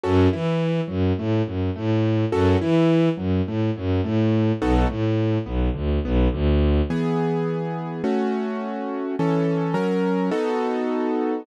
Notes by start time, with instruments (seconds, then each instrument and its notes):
0.03 violin F#2, acoustic grand piano C#4 F#4 A4
0.32 violin E3, acoustic grand piano E4
0.88 violin F#2, acoustic grand piano F#3
1.18 violin A2, acoustic grand piano A3
1.46 violin F#2, acoustic grand piano F#3
1.76 violin A2, acoustic grand piano A3
2.32 violin F#2, acoustic grand piano C#4 F#4 A4
2.60 violin E3, acoustic grand piano E4
3.17 violin F#2, acoustic grand piano F#3
3.46 violin A2, acoustic grand piano A3
3.76 violin F#2, acoustic grand piano F#3
4.04 violin A2, acoustic grand piano A3
4.61 violin B1, acoustic grand piano B3 D#4 F#4 A4
4.89 violin A2, acoustic grand piano A3
5.45 violin B1, acoustic grand piano B3
5.74 violin D2, acoustic grand piano D3
6.04 violin B1, acoustic grand piano B3
6.33 violin D2, acoustic grand piano D3
6.90 acoustic grand piano E3 B3 G#4
8.04 acoustic grand piano A3 C#4 F#4
9.19 acoustic grand piano E3 C#4 A4
9.74 acoustic grand piano F#3 C#4 A#4
10.31 acoustic grand piano B3 D#4 F#4 A4